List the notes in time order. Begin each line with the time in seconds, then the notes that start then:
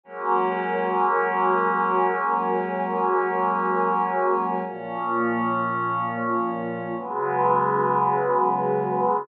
0.03 F#3 G#3 A#3 C#4 F#4 A#4 C#5 G#5
4.66 A#2 F3 A#3 C#4 F4 C#5
6.97 C#3 F#3 G#3 B3 C#4 F#4 G#4 B4